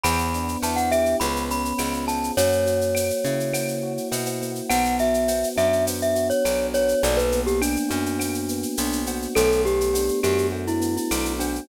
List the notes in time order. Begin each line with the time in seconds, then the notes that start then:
0.04 E2 B3 B5, cowbell, claves, shaker
0.19 shaker
0.34 D4, shaker
0.48 shaker
0.62 E2 E4 A5, cowbell, shaker
0.76 F#5, shaker
0.91 G4 E5, claves, shaker
1.05 shaker
1.20 C#2 B3 B5, cowbell, shaker
1.36 shaker
1.49 C#4 B5, shaker
1.65 shaker
1.78 C#2 F4, cowbell, claves, shaker
1.94 shaker
2.07 G#4 A5, cowbell, shaker
2.24 shaker
2.37 F#2 A#3 C#5, cowbell, shaker
2.52 shaker
2.65 F#4, shaker
2.81 shaker
2.95 A#3, cowbell, claves, shaker
3.10 shaker
3.25 C#3 E4, shaker
3.40 shaker
3.53 A#3, cowbell, claves, shaker
3.68 shaker
3.83 F#4
3.97 shaker
4.11 B2 E4, cowbell, shaker
4.26 cowbell, shaker
4.41 A#3, cowbell, shaker
4.55 shaker
4.69 B1 B3 F#5, cowbell, claves, shaker
4.85 shaker
4.99 F#4 E5, shaker
5.14 shaker
5.28 B3, cowbell, shaker
5.44 shaker
5.56 F#2 D4 E5, claves, shaker
5.73 shaker
5.87 B3, cowbell, shaker
6.02 E5, shaker
6.15 F#4, shaker
6.30 C#5, shaker
6.44 B1 D4, cowbell, claves, shaker
6.74 B3 C#5, cowbell, shaker
6.88 shaker
7.02 B1 A#3 D5, cowbell, shaker
7.17 B4, shaker
7.32 B3, shaker
7.46 G4, shaker
7.61 D4, cowbell, claves, shaker
7.76 shaker
7.89 F#2 D4 F#4, shaker
8.06 shaker
8.19 A#3, cowbell, claves, shaker
8.34 shaker
8.48 B3, shaker
8.63 shaker
8.77 B1 D4, cowbell, shaker
8.92 shaker
9.06 F#4, cowbell, shaker
9.22 shaker
9.35 B1 A3 A4, cowbell, claves, shaker
9.52 shaker
9.65 B3 G4, shaker
9.81 shaker
9.94 D4, cowbell, shaker
10.08 shaker
10.23 F#2 F#4 G4, claves, shaker
10.38 shaker
10.52 A3, cowbell
10.67 E4, shaker
10.80 B3, shaker
10.97 E4, shaker
11.11 B1 D4, cowbell, claves, shaker
11.25 shaker
11.39 D4 F#4, cowbell, shaker
11.55 shaker